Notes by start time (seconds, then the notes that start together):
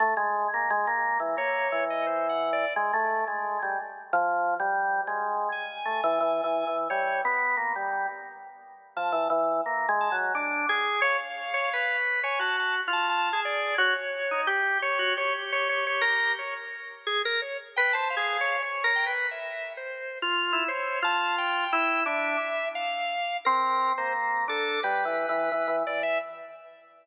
0.00 A3
0.17 G#3
0.54 A#3
0.70 G#3
0.87 A#3
1.20 E3
1.37 A#3 C#5
1.72 E3
1.90 D#5
2.07 C5
2.29 F#5
2.53 D5
2.76 G#3
2.93 A3
3.28 G#3
3.62 G3
4.13 F3
4.60 G3
5.07 G#3
5.52 G#5
5.85 A3
6.04 E3
6.20 E3
6.44 E3
6.67 E3
6.90 G3 C#5
7.25 B3
7.57 A#3
7.76 G3
8.97 F3 A5
9.12 E3
9.30 E3
9.66 A#3
9.89 G#3
10.01 A5
10.12 F#3
10.35 D4
10.69 G#4
11.02 C#5 F5
11.54 C#5
11.73 B4
12.23 C#5 G#5
12.39 F#4 A5
12.59 A5
12.88 F4
12.93 A5
13.09 A5
13.33 G#4
13.45 D5
13.78 F#4 C#5
14.31 D#4
14.47 G4
14.82 C#5
14.99 F#4
15.17 G4 C#5
15.52 C#5
15.69 C#5
15.87 C#5
16.01 A#4
16.39 C#5
17.07 G#4
17.25 A#4
17.42 C#5
17.76 B4 G5
17.93 C5 A5
18.10 F5
18.17 G#4
18.41 C#5
18.61 C#5
18.84 A#4
18.96 G5
19.06 B4
19.31 E5
19.77 C5
20.22 F4
20.53 E4
20.68 C5 C#5
21.02 F4 A5
21.38 G5
21.73 E4
22.06 D4 E5
22.75 F5
23.45 C4 A#4
23.98 A#3 C5
24.48 D4 A4
24.83 G3 B4
25.05 E3
25.29 E3
25.52 E3
25.68 E3
25.87 E3 D5
26.03 E5